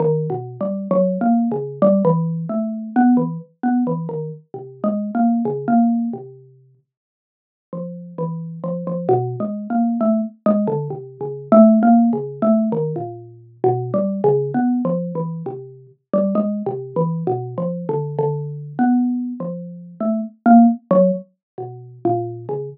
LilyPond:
\new Staff { \time 5/4 \tempo 4 = 66 \tuplet 3/2 { ees8 b,8 g8 ges8 bes8 des8 } g16 e8 a8 b16 e16 r16 b16 e16 ees16 r16 | \tuplet 3/2 { c8 aes8 bes8 } des16 bes8 c8. r4 f8 e8 f16 f16 | \tuplet 3/2 { b,8 aes8 bes8 } a16 r16 aes16 d16 \tuplet 3/2 { c8 des8 a8 bes8 des8 a8 } ees16 bes,8. | \tuplet 3/2 { b,8 g8 des8 b8 f8 e8 } c8 r16 g16 \tuplet 3/2 { aes8 c8 e8 b,8 f8 d8 } |
\tuplet 3/2 { d4 b4 f4 } a16 r16 bes16 r16 ges16 r8 b,8 bes,8 des16 | }